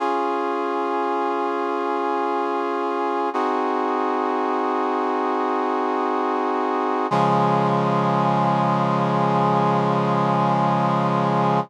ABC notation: X:1
M:3/4
L:1/8
Q:1/4=54
K:Db
V:1 name="Brass Section"
[DFA]6 | "^rit." [CEGA]6 | [D,F,A,]6 |]